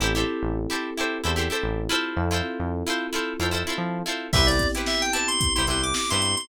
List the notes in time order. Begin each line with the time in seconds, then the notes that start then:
0.00 A1 C4 E4 G4 A4 C5
0.15 E4 G4 A4 C5
0.43 A1
0.70 E4 G4 A4 C5
0.98 E4 G4 A4 C5
1.24 E2 E4 G4 A4 C5
1.36 E4 G4 A4 C5
1.50 E4 G4 A4 C5
1.63 A1
1.89 E4 F4 A4 C5
2.16 F2 C4 E4 F4 A4
2.31 E4 F4 A4 C5
2.59 F2
2.87 E4 F4 A4 C5
3.13 E4 F4 A4 C5
3.39 F2 E4 F4 A4 C5
3.51 E4 F4 A4 C5
3.67 E4 F4 A4 C5
3.78 F3
4.06 E4 F4 A4 C5
4.33 C2 B3 C4 E4 G4 B4 C5 E5, kick, crash
4.47 D5, closed hi-hat
4.59 kick, closed hi-hat
4.75 E4 G4 B4 C5, closed hi-hat
4.86 E5, snare
5.02 G5, closed hi-hat
5.13 E4 G4 B4 C5 A5, closed hi-hat
5.28 C6, closed hi-hat
5.41 kick, closed hi-hat
5.55 C2 E4 G4 B4 C5 C6, snare, closed hi-hat
5.67 C2 E4 G4 B4 C6, snare, closed hi-hat
5.71 C5
5.83 D6, closed hi-hat
5.94 D6, snare
6.10 G2 E4 G4 B4 C5 C6, closed hi-hat
6.22 closed hi-hat
6.37 C6, snare, closed hi-hat